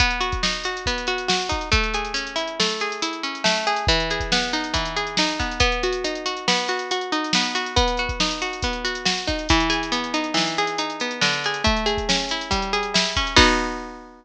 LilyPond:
<<
  \new Staff \with { instrumentName = "Pizzicato Strings" } { \time 4/4 \key b \mixolydian \tempo 4 = 139 b8 fis'8 dis'8 fis'8 b8 fis'8 fis'8 dis'8 | \time 5/4 a8 gis'8 cis'8 e'8 a8 gis'8 e'8 cis'8 a8 gis'8 | \time 4/4 e8 gis'8 b8 dis'8 e8 gis'8 dis'8 b8 | \time 5/4 b8 fis'8 dis'8 fis'8 b8 fis'8 fis'8 dis'8 b8 fis'8 |
\time 4/4 b8 fis'8 dis'8 fis'8 b8 fis'8 fis'8 dis'8 | \time 5/4 e8 gis'8 b8 dis'8 e8 gis'8 dis'8 b8 d8 gis'8 | \time 4/4 a8 gis'8 cis'8 e'8 g8 gis'8 e'8 cis'8 | \time 5/4 <b dis' fis'>1~ <b dis' fis'>4 | }
  \new DrumStaff \with { instrumentName = "Drums" } \drummode { \time 4/4 <hh bd>16 hh16 hh16 <hh bd>16 sn16 hh16 hh16 hh16 <hh bd>16 hh16 hh16 hh16 sn16 hh16 <hh bd>16 hh16 | \time 5/4 <hh bd>16 hh16 hh16 hh16 hh16 hh16 hh16 hh16 sn16 hh16 hh16 hh16 hh16 hh16 hh16 hh16 sn16 hh16 hh16 hh16 | \time 4/4 <hh bd>16 hh16 hh16 <hh bd>16 sn16 hh16 hh16 hh16 <hh bd>16 hh16 hh16 hh16 sn16 hh16 <hh bd>16 hh16 | \time 5/4 <hh bd>16 hh16 hh16 hh16 hh16 hh16 hh16 hh16 sn16 hh16 hh16 hh16 hh16 hh16 hh16 hh16 sn16 hh16 hh16 hh16 |
\time 4/4 <hh bd>16 hh16 hh16 <hh bd>16 sn16 hh16 hh16 hh16 <hh bd>16 hh16 hh16 hh16 sn16 hh16 <hh bd>16 hh16 | \time 5/4 <hh bd>16 hh16 hh16 hh16 hh16 hh16 hh16 hh16 sn16 hh16 hh16 hh16 hh16 hh16 hh16 hh16 sn16 hh16 hh16 hh16 | \time 4/4 <hh bd>16 hh16 hh16 <hh bd>16 sn16 hh16 hh16 hh16 <hh bd>16 hh16 hh16 hh16 sn16 hh16 <hh bd>16 hh16 | \time 5/4 <cymc bd>4 r4 r4 r4 r4 | }
>>